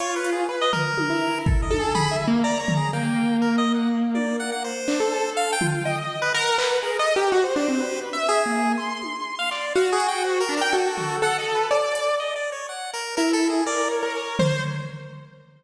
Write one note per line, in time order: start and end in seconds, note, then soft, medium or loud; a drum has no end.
0.00 0.44 F4 medium
0.00 0.15 C#5 medium
0.00 closed hi-hat medium
0.16 0.31 B4 medium
0.24 closed hi-hat medium
0.32 0.47 G#4 medium
0.49 0.71 B4 medium
0.61 0.72 D#5 loud
0.73 1.39 A#4 loud
0.73 floor tom medium
0.98 high tom medium
1.10 1.65 E4 medium
1.46 1.61 A4 medium
1.46 kick loud
1.62 1.77 D#5 medium
1.70 1.92 A4 medium
1.70 high tom medium
1.79 1.94 G#4 medium
1.95 2.16 G#4 loud
1.95 2.10 B5 medium
1.95 floor tom loud
2.11 2.26 E5 medium
2.27 2.42 A#3 loud
2.44 2.58 D5 medium
2.44 2.88 A#5 medium
2.60 2.74 C#5 medium
2.68 floor tom loud
2.77 2.91 G#4 medium
2.93 4.69 A#3 medium
2.93 3.37 G5 medium
3.42 3.56 A#4 medium
3.58 3.72 D#5 loud
3.74 3.89 F#5 medium
4.15 4.37 D5 medium
4.15 high tom medium
4.40 4.51 F#5 medium
4.52 4.63 F#5 medium
4.64 5.30 C5 medium
4.88 4.99 D4 medium
4.88 clap medium
5.00 5.55 A4 medium
5.12 cowbell medium
5.37 5.51 F5 medium
5.53 5.67 G5 loud
5.61 5.83 F4 medium
5.61 floor tom medium
5.69 5.83 G5 medium
5.85 6.29 D#5 medium
5.85 5.96 G5 medium
5.98 6.20 D#5 soft
6.22 6.33 B4 loud
6.34 6.56 A#4 loud
6.34 6.78 F#5 medium
6.58 6.80 B4 medium
6.58 clap loud
6.83 6.97 G#4 medium
6.83 6.98 A#4 medium
6.99 7.14 A4 medium
6.99 7.14 D#5 loud
7.15 7.31 G4 loud
7.15 7.30 A#4 medium
7.32 7.43 F#4 loud
7.32 7.54 C5 medium
7.44 7.55 C5 medium
7.56 7.67 D4 medium
7.56 8.00 C5 medium
7.56 clap medium
7.68 7.79 C4 medium
7.80 8.09 B4 soft
8.13 8.42 E5 medium
8.29 8.72 G#4 loud
8.46 8.75 A#3 medium
8.78 9.65 C6 medium
9.02 high tom medium
9.39 9.50 F5 medium
9.51 9.73 D5 medium
9.51 clap medium
9.75 10.41 F#4 loud
9.75 9.90 F5 medium
9.92 10.07 G#4 loud
10.00 closed hi-hat medium
10.08 10.23 G5 loud
10.24 10.39 C5 medium
10.40 10.55 A#4 loud
10.49 10.60 D4 loud
10.57 10.72 A#4 medium
10.61 10.72 G5 medium
10.72 11.17 F#4 medium
10.72 11.16 A4 medium
10.98 floor tom medium
11.22 11.66 A4 medium
11.22 11.37 F#5 loud
11.38 11.53 D#5 medium
11.55 11.70 B4 medium
11.71 12.15 D5 medium
11.71 cowbell loud
11.95 closed hi-hat medium
12.20 12.34 D#5 medium
12.36 12.50 D5 medium
12.52 12.67 C#5 medium
12.69 12.91 F#5 medium
12.93 13.15 A#4 medium
13.17 13.61 E4 medium
13.17 13.32 A#4 loud
13.33 13.48 A4 loud
13.50 13.64 G#4 medium
13.66 13.99 A#4 medium
13.66 13.88 D5 loud
13.91 14.57 C#5 medium
14.03 14.35 A#4 medium
14.15 cowbell medium
14.39 14.61 C5 medium
14.39 floor tom loud